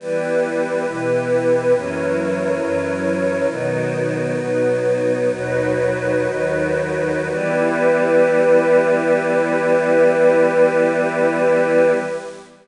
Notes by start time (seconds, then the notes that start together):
0.00 E3 G3 B3 E4 G4 B4
0.86 B2 E3 B3
1.74 F#2 E3 F#3 A#3 C#4 E4 A#4 C#5
2.60 F#2 E3 F#3 C#4
3.48 B2 D#3 F#3 B3 D#4 F#4
4.36 B2 F#3 B3
5.29 D#2 B2 F#3 D#4 F#4 B4
6.27 D#2 D#3 F#3
7.29 E3 G3 B3 E4 G4 B4